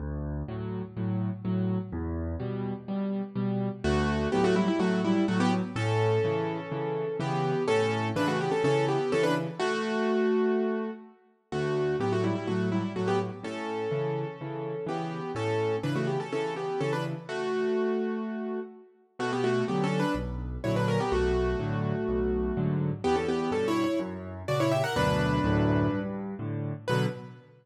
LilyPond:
<<
  \new Staff \with { instrumentName = "Acoustic Grand Piano" } { \time 4/4 \key d \major \tempo 4 = 125 r1 | r1 | <a fis'>4 <b g'>16 <a fis'>16 <g e'>16 <g e'>16 <a fis'>8 <g e'>8 <a fis'>16 <b g'>16 r8 | <cis' a'>2. <b g'>4 |
<cis' a'>4 <d' b'>16 <a fis'>16 <b g'>16 <cis' a'>16 <cis' a'>8 <b g'>8 <cis' a'>16 <d' b'>16 r8 | <a fis'>2. r4 | <a fis'>4 <b g'>16 <a fis'>16 <g e'>16 <g e'>16 <a fis'>8 <g e'>8 <a fis'>16 <b g'>16 r8 | <cis' a'>2. <b g'>4 |
<cis' a'>4 <d' b'>16 <a fis'>16 <b g'>16 <cis' a'>16 <cis' a'>8 <b g'>8 <cis' a'>16 <d' b'>16 r8 | <a fis'>2. r4 | \key b \minor <a fis'>16 <b g'>16 <a fis'>8 \tuplet 3/2 { <b g'>8 <cis' a'>8 <d' b'>8 } r4 <e' cis''>16 <d' b'>16 <cis' ais'>16 <b g'>16 | <a fis'>1 |
<b g'>16 <cis' a'>16 <b g'>8 \tuplet 3/2 { <cis' a'>8 <e' cis''>8 <e' cis''>8 } r4 <fis' d''>16 <e' cis''>16 <g' e''>16 <ais' fis''>16 | <d' b'>2~ <d' b'>8 r4. | b'4 r2. | }
  \new Staff \with { instrumentName = "Acoustic Grand Piano" } { \clef bass \time 4/4 \key d \major d,4 <a, fis>4 <a, fis>4 <a, fis>4 | e,4 <b, g>4 <b, g>4 <b, g>4 | d,4 <a, fis>4 <a, fis>4 <a, fis>4 | a,4 <cis e>4 <cis e>4 <cis e>4 |
a,4 <cis e>4 <cis e>4 <cis e>4 | r1 | d,4 <a, fis>4 <a, fis>4 <a, fis>4 | a,4 <cis e>4 <cis e>4 <cis e>4 |
a,4 <cis e>4 <cis e>4 <cis e>4 | r1 | \key b \minor b,4 <d fis>4 b,,4 <ais, d fis>4 | b,,4 <a, d fis>4 b,,4 <gis, d fis>4 |
e,4 <g, b,>4 fis,4 <ais, cis>4 | <d, fis, b,>4 <d, fis, a,>4 g,4 <a, d>4 | <b, d fis>4 r2. | }
>>